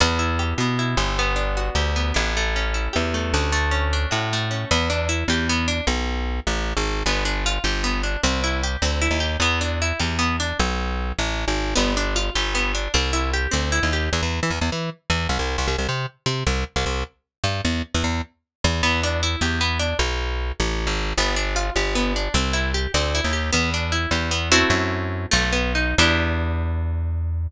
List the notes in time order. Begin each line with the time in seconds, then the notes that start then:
0.00 E2 B3
0.19 E4
0.39 G4
0.58 B2 B3
0.79 E4
0.97 G1 G4
1.19 B3
1.36 D4
1.57 F#4
1.75 D2 G4
1.96 B3
2.14 A1 D4
2.37 A3
2.56 C#4
2.74 E4
2.93 E2 G4
3.14 A3
3.34 D2 C#4
3.52 A3
3.71 C#4
3.93 D4
4.11 A2 F#4
4.33 A3
4.51 C#4
4.71 E2 B3
4.90 D4
5.09 E4
5.28 E2 G4
5.49 B3
5.68 D4
5.87 B1
6.47 A1
6.77 G#1
7.06 G1 B3
7.25 D4
7.46 F4
7.64 G1 G4
7.84 B3
8.03 D4
8.23 C2 C4
8.44 E4
8.63 G4
8.82 D2 C4
9.02 E4
9.11 D#2
9.20 G4
9.40 E2 B3
9.61 D4
9.82 E4
10.00 E2 G4
10.19 B3
10.40 D4
10.59 B1
11.19 A1
11.48 G#1
11.75 G1 B3
11.97 D4
12.16 F4
12.35 G1 G4
12.55 B3
12.75 D4
12.94 C2 C4
13.13 E4
13.33 G4
13.51 D2 C4
13.72 E4
13.83 D#2
13.93 G4
14.13 E2
14.22 E2
14.43 E3
14.50 E2
14.61 E2
14.72 E3
15.10 E2
15.29 C2
15.39 C2
15.58 C2
15.68 C2
15.78 C2
15.89 C3
16.26 C3
16.47 C2
16.76 C2
16.86 C2
17.44 G2
17.65 E2
17.94 E2
18.04 E2
18.64 E2
18.83 E2 B3
19.03 D4
19.23 E4
19.41 E2 G4
19.61 B3
19.79 D4
19.99 B1
20.60 A1
20.87 G#1
21.17 G1 B3
21.36 D4
21.56 F4
21.76 G1 G4
21.95 B3
22.16 D4
22.34 C2 C4
22.53 E4
22.74 G4
22.94 D2 C4
23.15 E4
23.24 D#2
23.33 G4
23.53 E2 B3
23.74 D4
23.92 E4
24.11 E2 G4
24.31 B3
24.52 A3 C4 E4 F#4
24.70 F#2
25.31 B1 A3
25.53 B3
25.75 D#4
25.98 E2 B3 D4 E4 G4